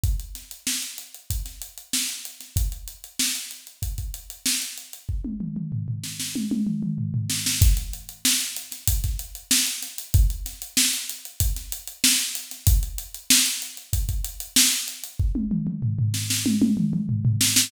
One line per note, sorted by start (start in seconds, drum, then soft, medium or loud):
0.04 kick medium
0.04 closed hi-hat medium
0.20 closed hi-hat medium
0.35 snare soft
0.35 closed hi-hat medium
0.51 closed hi-hat medium
0.67 snare loud
0.82 closed hi-hat medium
0.98 closed hi-hat medium
1.14 closed hi-hat medium
1.30 kick medium
1.30 closed hi-hat loud
1.46 snare soft
1.46 closed hi-hat medium
1.62 closed hi-hat medium
1.78 closed hi-hat medium
1.93 snare loud
2.09 snare soft
2.09 closed hi-hat medium
2.25 closed hi-hat medium
2.40 snare soft
2.40 closed hi-hat medium
2.56 kick medium
2.56 closed hi-hat loud
2.72 closed hi-hat medium
2.88 closed hi-hat medium
3.04 closed hi-hat medium
3.19 snare loud
3.35 closed hi-hat medium
3.51 closed hi-hat medium
3.67 closed hi-hat medium
3.82 kick medium
3.82 closed hi-hat medium
3.98 kick medium
3.98 closed hi-hat medium
4.14 closed hi-hat medium
4.30 closed hi-hat medium
4.46 snare loud
4.62 closed hi-hat medium
4.78 closed hi-hat medium
4.93 closed hi-hat medium
5.09 kick medium
5.25 high tom medium
5.40 mid tom medium
5.56 mid tom medium
5.72 floor tom medium
5.88 floor tom medium
6.04 snare medium
6.20 snare medium
6.36 high tom medium
6.51 high tom medium
6.67 mid tom medium
6.83 mid tom medium
6.98 floor tom medium
7.14 floor tom medium
7.30 snare medium
7.46 snare loud
7.62 kick loud
7.62 closed hi-hat loud
7.77 closed hi-hat medium
7.93 closed hi-hat medium
8.09 closed hi-hat medium
8.25 snare loud
8.41 closed hi-hat medium
8.56 closed hi-hat medium
8.72 snare soft
8.72 closed hi-hat medium
8.88 kick medium
8.88 closed hi-hat loud
9.04 kick medium
9.04 snare soft
9.04 closed hi-hat medium
9.19 closed hi-hat medium
9.35 closed hi-hat medium
9.51 snare loud
9.67 closed hi-hat medium
9.82 snare soft
9.82 closed hi-hat medium
9.98 closed hi-hat medium
10.14 kick loud
10.14 closed hi-hat loud
10.30 closed hi-hat medium
10.46 snare soft
10.46 closed hi-hat medium
10.62 closed hi-hat medium
10.77 snare loud
10.93 closed hi-hat medium
11.09 closed hi-hat medium
11.25 closed hi-hat medium
11.40 kick medium
11.40 closed hi-hat loud
11.56 snare soft
11.56 closed hi-hat medium
11.72 closed hi-hat loud
11.88 closed hi-hat medium
12.04 snare loud
12.19 snare soft
12.19 closed hi-hat medium
12.35 closed hi-hat medium
12.51 snare soft
12.51 closed hi-hat medium
12.67 kick loud
12.67 closed hi-hat loud
12.83 closed hi-hat medium
12.98 closed hi-hat medium
13.14 closed hi-hat medium
13.30 snare loud
13.46 closed hi-hat medium
13.62 closed hi-hat medium
13.77 closed hi-hat medium
13.93 kick medium
13.93 closed hi-hat loud
14.09 kick medium
14.09 closed hi-hat medium
14.24 closed hi-hat medium
14.40 closed hi-hat medium
14.56 snare loud
14.72 closed hi-hat medium
14.88 closed hi-hat medium
15.04 closed hi-hat medium
15.20 kick loud
15.35 high tom medium
15.51 mid tom medium
15.67 mid tom medium
15.83 floor tom medium
15.99 floor tom medium
16.14 snare medium
16.30 snare loud
16.46 high tom loud
16.62 high tom loud
16.77 mid tom loud
16.93 mid tom loud
17.09 floor tom medium
17.25 floor tom loud
17.41 snare loud
17.56 snare loud